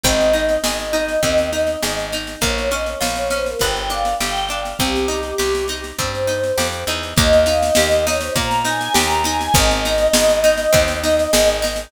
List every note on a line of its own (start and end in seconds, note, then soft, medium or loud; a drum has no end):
0.03 0.58 G#1 medium
0.03 0.31 C4 loud
0.03 1.98 D#5 medium
0.03 kick loud
0.03 snare medium
0.21 snare medium
0.33 0.60 D#4 medium
0.33 snare medium
0.49 snare medium
0.64 1.17 G#1 medium
0.64 0.91 G#4 medium
0.64 snare loud
0.80 snare medium
0.93 1.20 D#4 medium
0.93 snare medium
1.08 snare medium
1.23 1.76 D#2 medium
1.23 1.49 C4 medium
1.23 kick medium
1.23 snare medium
1.38 snare medium
1.53 1.79 D#4 medium
1.53 snare medium
1.67 snare medium
1.83 2.36 G#1 medium
1.83 2.10 G#4 medium
1.83 snare loud
1.99 snare medium
2.12 2.40 D#4 medium
2.12 snare medium
2.27 snare medium
2.41 2.95 A#1 medium
2.41 2.68 A#3 loud
2.41 2.68 C#5 medium
2.41 kick medium
2.41 snare medium
2.58 snare medium
2.71 2.98 C#4 medium
2.71 2.86 D#5 medium
2.71 snare medium
2.86 3.25 C#5 medium
2.86 snare medium
3.00 3.55 A#1 medium
3.00 3.27 F4 medium
3.00 snare loud
3.16 snare medium
3.30 3.57 C#4 medium
3.30 3.45 C5 medium
3.30 snare medium
3.46 3.60 A#4 medium
3.46 snare medium
3.59 4.14 G1 medium
3.59 3.88 B3 loud
3.59 3.88 G5 medium
3.59 kick medium
3.59 snare medium
3.76 snare medium
3.90 4.17 D4 medium
3.90 4.14 F5 medium
3.90 snare medium
4.05 snare medium
4.20 4.74 G1 medium
4.20 4.47 G4 medium
4.20 4.49 G5 medium
4.20 snare loud
4.36 snare medium
4.49 4.77 D4 medium
4.49 4.76 F5 medium
4.49 snare medium
4.65 snare medium
4.79 5.33 C2 medium
4.79 5.06 C4 loud
4.79 5.78 G4 medium
4.79 kick medium
4.79 snare medium
4.96 snare medium
5.08 5.35 D#4 medium
5.08 snare medium
5.23 snare medium
5.38 5.93 C2 medium
5.38 5.65 G4 medium
5.38 snare medium
5.55 snare medium
5.68 5.96 D#4 medium
5.68 snare medium
5.84 snare medium
5.98 6.52 G2 medium
5.98 6.25 C4 medium
5.98 6.56 C5 medium
5.98 kick medium
5.98 snare medium
6.15 snare medium
6.27 6.54 D#4 medium
6.27 snare medium
6.44 snare medium
6.58 6.84 F2 medium
6.58 6.84 G4 medium
6.58 snare loud
6.73 snare medium
6.87 7.14 E2 medium
6.87 7.15 D#4 medium
6.87 snare medium
7.03 snare medium
7.16 7.71 D#2 loud
7.16 7.44 A#3 loud
7.16 7.41 D#5 loud
7.16 kick loud
7.16 snare medium
7.33 snare medium
7.46 7.73 D#4 loud
7.46 7.61 F5 medium
7.46 snare medium
7.62 8.00 D#5 medium
7.62 snare medium
7.75 8.30 D#2 medium
7.75 8.04 G4 loud
7.75 snare loud
7.91 snare medium
8.06 8.34 D#4 loud
8.06 8.20 C#5 medium
8.06 snare loud
8.21 8.35 C5 medium
8.21 snare medium
8.36 8.89 A#2 medium
8.36 8.62 A#3 loud
8.36 8.60 A#5 medium
8.36 kick medium
8.36 snare medium
8.51 snare medium
8.65 8.92 D#4 medium
8.65 8.93 G#5 medium
8.65 snare medium
8.81 snare medium
8.94 9.49 D#2 medium
8.94 9.21 G4 loud
8.94 9.23 A#5 medium
8.94 snare loud
9.11 snare medium
9.24 9.52 D#4 loud
9.24 9.54 G#5 medium
9.24 snare medium
9.41 snare medium
9.54 10.08 G#1 loud
9.54 9.81 C4 loud
9.54 11.49 D#5 medium
9.54 kick loud
9.54 snare medium
9.71 snare medium
9.85 10.12 D#4 loud
9.85 snare medium
9.98 snare medium
10.13 10.67 G#1 medium
10.13 10.41 G#4 loud
10.13 snare loud
10.29 snare medium
10.44 10.71 D#4 loud
10.44 snare medium
10.58 snare medium
10.73 11.27 D#2 medium
10.73 10.99 C4 loud
10.73 kick loud
10.73 snare medium
10.88 snare medium
11.03 11.30 D#4 medium
11.03 snare medium
11.19 snare medium
11.33 11.87 G#1 medium
11.33 11.60 G#4 loud
11.33 snare loud
11.48 snare medium
11.62 11.89 D#4 loud
11.62 snare medium
11.76 snare medium